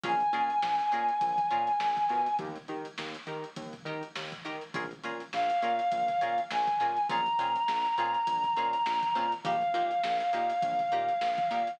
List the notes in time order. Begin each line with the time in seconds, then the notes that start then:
0.04 A#1 C#4 F4 G#4 A#4 G#5, kick, closed hi-hat
0.20 closed hi-hat
0.33 A#2 C#4 F4 G#4 A#4, closed hi-hat
0.50 closed hi-hat
0.62 A#1, snare
0.79 closed hi-hat
0.92 A#2 C#4 F4 G#4 A#4, closed hi-hat
1.09 closed hi-hat
1.21 A#1, kick, closed hi-hat
1.38 kick, closed hi-hat
1.51 A#2 C#4 F4 G#4 A#4, closed hi-hat
1.67 snare, closed hi-hat
1.80 A#1, snare
1.97 kick, closed hi-hat
2.09 B2 C#4 F4 G#4 A#4, snare, closed hi-hat
2.26 closed hi-hat
2.39 D#2 D#4 G4 A#4, kick, closed hi-hat
2.56 closed hi-hat
2.68 D#3 D#4 G4 A#4, closed hi-hat
2.85 closed hi-hat
2.98 D#2, snare
3.14 closed hi-hat
3.27 D#3 D#4 G4 A#4, closed hi-hat
3.44 closed hi-hat
3.56 D#2, kick, closed hi-hat
3.73 kick, closed hi-hat
3.85 D#3 D#4 G4 A#4, closed hi-hat
4.03 closed hi-hat
4.16 D#2, snare
4.32 kick, closed hi-hat
4.45 D#3 D#4 G4 A#4, snare, closed hi-hat
4.61 closed hi-hat
4.74 A#1 C#4 F4 G#4 A#4, kick, closed hi-hat
4.91 closed hi-hat
5.04 A#2 C#4 F4 G#4 A#4, closed hi-hat
5.20 closed hi-hat
5.33 A#1 F5, snare
5.50 closed hi-hat
5.62 A#2 C#4 F4 G#4 A#4, closed hi-hat
5.79 closed hi-hat
5.92 A#1, kick, closed hi-hat
6.08 kick, snare, closed hi-hat
6.21 A#2 C#4 F4 G#4 A#4, closed hi-hat
6.38 closed hi-hat
6.51 A#1 G#5, snare
6.67 kick, closed hi-hat
6.80 A#2 C#4 F4 G#4 A#4, snare, closed hi-hat
6.97 closed hi-hat
7.09 A#1 C4 C#4 F4 G#4 A#5, kick, closed hi-hat
7.26 closed hi-hat
7.39 A#2 C4 C#4 F4 G#4, closed hi-hat
7.56 closed hi-hat
7.68 A#1, snare
7.85 closed hi-hat
7.98 A#2 C4 C#4 F4 G#4, closed hi-hat
8.14 closed hi-hat
8.27 A#1, kick, closed hi-hat
8.44 kick, closed hi-hat
8.56 A#2 C4 C#4 F4 G#4, closed hi-hat
8.73 closed hi-hat
8.86 A#1, snare
9.03 kick, closed hi-hat
9.15 A#2 C4 C#4 F4 G#4, snare, closed hi-hat
9.32 closed hi-hat
9.44 A#1 A#3 D#4 G4 F5, kick, closed hi-hat
9.62 closed hi-hat
9.74 A#2 A#3 D#4 G4, snare, closed hi-hat
9.91 closed hi-hat
10.04 A#1, snare
10.20 closed hi-hat
10.33 A#2 A#3 D#4 G4, snare, closed hi-hat
10.50 closed hi-hat
10.62 A#1, kick, closed hi-hat
10.79 kick, snare, closed hi-hat
10.92 A#2 A#3 D#4 G4, closed hi-hat
11.09 closed hi-hat
11.21 A#1, snare
11.38 kick, closed hi-hat
11.51 A#2 A#3 D#4 G4, snare, closed hi-hat
11.67 snare, closed hi-hat